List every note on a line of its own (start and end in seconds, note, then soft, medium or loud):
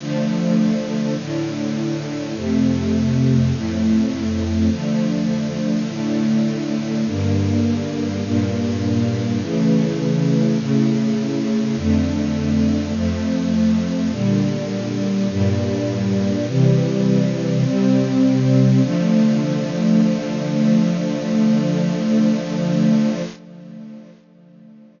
0.00 1.16 D3 medium
0.00 1.16 F3 medium
0.00 1.16 A3 loud
1.17 2.34 A2 medium
1.17 2.34 D3 medium
1.17 2.34 A3 medium
2.36 3.52 F2 medium
2.36 3.52 C3 medium
2.36 3.52 A3 medium
3.53 4.69 F2 medium
3.53 4.69 A2 medium
3.53 4.69 A3 medium
4.71 5.87 D3 medium
4.71 5.87 F3 medium
4.71 5.87 A3 medium
5.88 7.05 A2 medium
5.88 7.05 D3 medium
5.88 7.05 A3 medium
7.07 8.23 G2 medium
7.07 8.23 D3 medium
7.07 8.23 A#3 medium
8.24 9.40 G2 medium
8.24 9.40 A#2 medium
8.24 9.40 A#3 medium
9.41 10.58 C#3 medium
9.41 10.58 E3 medium
9.41 10.58 A3 medium
10.59 11.75 A2 medium
10.59 11.75 C#3 medium
10.59 11.75 A3 medium
11.76 12.93 F2 medium
11.76 12.93 D3 loud
11.76 12.93 A3 medium
12.95 14.11 F2 medium
12.95 14.11 F3 medium
12.95 14.11 A3 loud
14.11 15.28 A#2 medium
14.11 15.28 D3 medium
14.11 15.28 G3 medium
15.29 16.46 G2 medium
15.29 16.46 A#2 medium
15.29 16.46 G3 medium
16.47 17.64 C3 medium
16.47 17.64 E3 medium
16.47 17.64 G3 medium
17.64 18.81 C3 medium
17.64 18.81 G3 medium
17.64 18.81 C4 loud
18.83 23.22 D3 loud
18.83 23.22 F3 loud
18.83 23.22 A3 loud